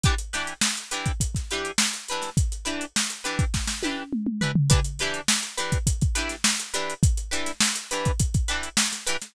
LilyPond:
<<
  \new Staff \with { instrumentName = "Acoustic Guitar (steel)" } { \time 4/4 \key e \dorian \tempo 4 = 103 <e d' g' b'>8 <e d' g' b'>4 <e d' g' b'>4 <e d' g' b'>4 <e d' g' b'>8~ | <e d' g' b'>8 <e d' g' b'>4 <e d' g' b'>4 <e d' g' b'>4 <e d' g' b'>8 | <e d' g' b'>8 <e d' g' b'>4 <e d' g' b'>4 <e d' g' b'>4 <e d' g' b'>8~ | <e d' g' b'>8 <e d' g' b'>4 <e d' g' b'>4 <e d' g' b'>4 <e d' g' b'>8 | }
  \new DrumStaff \with { instrumentName = "Drums" } \drummode { \time 4/4 <hh bd>16 hh16 <hh sn>16 hh16 sn16 hh16 hh16 <hh bd>16 <hh bd>16 <hh bd sn>16 hh16 hh16 sn16 hh16 hh16 <hh sn>16 | <hh bd>16 hh16 hh16 hh16 sn16 hh16 hh16 <hh bd>16 <bd sn>16 sn16 tommh8 toml16 toml16 tomfh16 tomfh16 | <hh bd>16 hh16 <hh sn>16 hh16 sn16 hh16 hh16 <hh bd>16 <hh bd>16 <hh bd>16 hh16 <hh sn>16 sn16 hh16 hh16 hh16 | <hh bd>16 hh16 hh16 <hh sn>16 sn16 hh16 hh16 <hh bd>16 <hh bd>16 <hh bd>16 hh16 hh16 sn16 <hh sn>16 hh16 <hh sn>16 | }
>>